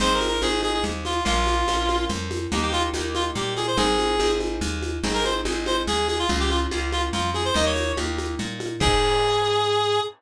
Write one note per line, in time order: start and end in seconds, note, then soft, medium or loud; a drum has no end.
0.00 0.38 G#1 loud
0.00 0.38 C4 loud
0.00 0.38 D#4 loud
0.00 0.38 G#4 loud
0.00 0.13 C5 medium
0.00 low conga medium
0.00 shaker medium
0.14 0.27 A#4 medium
0.21 high conga medium
0.21 shaker medium
0.28 0.41 A#4 medium
0.42 0.80 G#1 medium
0.42 1.17 C4 medium
0.42 1.17 D#4 medium
0.42 1.17 G#4 medium
0.42 0.61 G#4 medium
0.42 high conga medium
0.42 shaker medium
0.63 0.73 G#4 medium
0.63 high conga medium
0.63 shaker medium
0.73 0.83 G#4 medium
0.84 1.21 D#2 medium
0.84 low conga medium
0.84 shaker medium
1.05 1.24 F4 medium
1.05 high conga medium
1.05 shaker medium
1.25 1.64 A#1 loud
1.25 1.63 A#3 loud
1.25 1.63 C#4 loud
1.25 1.63 F4 loud
1.25 2.05 F4 medium
1.25 low conga medium
1.25 shaker medium
1.47 high conga medium
1.47 shaker medium
1.68 2.06 A#1 medium
1.68 2.44 A#3 medium
1.68 2.44 C#4 medium
1.68 2.44 F4 medium
1.68 high conga medium
1.68 shaker medium
1.89 high conga medium
1.89 shaker medium
2.09 2.47 F2 loud
2.09 low conga medium
2.09 shaker medium
2.31 high conga medium
2.31 shaker medium
2.52 2.90 D#2 loud
2.52 2.91 A#3 loud
2.52 2.91 D#4 loud
2.52 2.91 G4 loud
2.52 low conga medium
2.52 shaker medium
2.62 2.72 G4 medium
2.73 2.83 F4 medium
2.73 high conga medium
2.73 shaker medium
2.94 3.31 D#2 medium
2.94 3.71 A#3 medium
2.94 3.71 D#4 medium
2.94 3.71 G4 medium
2.94 high conga medium
2.94 shaker medium
3.15 3.25 F4 medium
3.15 high conga medium
3.15 shaker medium
3.35 3.73 A#2 medium
3.35 3.54 G4 medium
3.35 low conga medium
3.35 shaker medium
3.57 3.67 G#4 medium
3.57 high conga medium
3.57 shaker medium
3.67 3.77 C5 medium
3.77 4.15 G#1 loud
3.77 4.15 C4 loud
3.77 4.15 D#4 loud
3.77 4.15 G#4 loud
3.77 4.32 G#4 medium
3.77 low conga medium
3.77 shaker medium
3.99 high conga medium
3.99 shaker medium
4.19 4.57 G#1 loud
4.19 4.96 C4 medium
4.19 4.96 D#4 medium
4.19 4.96 G#4 medium
4.19 high conga medium
4.19 shaker medium
4.40 high conga medium
4.40 shaker soft
4.61 4.99 D#2 loud
4.61 low conga medium
4.61 shaker medium
4.82 high conga medium
4.82 shaker medium
5.03 5.41 G#1 loud
5.03 5.42 C4 loud
5.03 5.42 D#4 medium
5.03 5.42 G#4 loud
5.03 low conga medium
5.03 shaker medium
5.14 5.24 A#4 medium
5.24 5.34 C5 medium
5.24 high conga medium
5.24 shaker medium
5.45 5.83 G#1 medium
5.45 6.21 C4 medium
5.45 6.21 D#4 medium
5.45 6.21 G#4 medium
5.45 high conga medium
5.45 shaker medium
5.66 5.76 C5 medium
5.66 high conga medium
5.66 shaker medium
5.87 6.25 D#2 medium
5.87 6.07 G#4 medium
5.87 low conga medium
5.87 shaker medium
6.08 6.18 G#4 medium
6.08 high conga medium
6.08 shaker medium
6.19 6.29 F4 medium
6.29 6.67 C#2 loud
6.29 6.67 A#3 medium
6.29 6.67 C#4 loud
6.29 6.67 F4 loud
6.29 low conga medium
6.29 shaker medium
6.40 6.50 G4 medium
6.50 6.60 F4 medium
6.50 high conga medium
6.50 shaker medium
6.71 7.09 C#2 medium
6.71 7.47 A#3 medium
6.71 7.47 C#4 medium
6.71 7.47 F4 medium
6.71 high conga medium
6.71 shaker medium
6.92 7.02 F4 medium
6.92 high conga medium
6.92 shaker medium
7.13 7.51 F2 medium
7.13 7.30 F4 medium
7.13 low conga medium
7.13 shaker medium
7.34 7.44 G#4 medium
7.34 high conga medium
7.34 shaker soft
7.45 7.55 C5 medium
7.54 7.93 D#2 loud
7.54 7.92 A#3 loud
7.54 7.92 D#4 loud
7.54 7.92 G4 loud
7.54 7.65 D#5 medium
7.54 low conga medium
7.54 shaker medium
7.66 7.92 C#5 medium
7.76 high conga medium
7.76 shaker medium
7.97 8.35 D#2 medium
7.97 8.73 A#3 medium
7.97 8.73 D#4 medium
7.97 8.73 G4 medium
7.97 high conga medium
7.97 shaker medium
8.18 high conga medium
8.18 shaker medium
8.39 8.77 A#2 medium
8.39 low conga medium
8.39 shaker medium
8.60 high conga medium
8.60 shaker medium
8.80 10.00 G#2 loud
8.80 9.99 C4 loud
8.80 9.99 D#4 loud
8.80 9.99 G#4 loud
8.80 10.00 G#4 loud
8.80 kick loud
8.80 crash loud